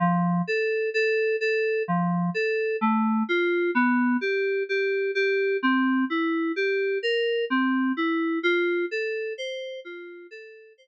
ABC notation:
X:1
M:3/4
L:1/8
Q:1/4=64
K:F
V:1 name="Electric Piano 2"
F, A A A F, A | A, F =B, G G G | C E G B C E | F A c F A c |]